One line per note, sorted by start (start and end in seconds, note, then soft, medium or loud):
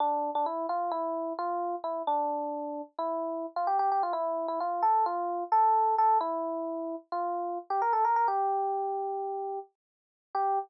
0.00 0.30 D4 loud
0.35 0.46 D4 loud
0.46 0.66 E4 medium
0.69 0.91 F4 medium
0.91 1.33 E4 loud
1.39 1.75 F4 loud
1.84 2.02 E4 medium
2.07 2.82 D4 loud
2.99 3.46 E4 medium
3.56 3.67 F4 medium
3.67 3.78 G4 medium
3.79 3.90 G4 loud
3.92 4.03 G4 medium
4.03 4.14 F4 loud
4.13 4.47 E4 loud
4.48 4.59 E4 medium
4.60 4.82 F4 medium
4.82 5.05 A4 medium
5.06 5.44 F4 medium
5.52 5.95 A4 medium
5.98 6.18 A4 medium
6.21 6.95 E4 loud
7.12 7.58 F4 medium
7.70 7.81 G4 medium
7.82 7.93 A#4 medium
7.93 8.04 A4 medium
8.05 8.16 A#4 medium
8.16 8.27 A#4 medium
8.28 9.59 G4 medium
10.35 10.59 G4 loud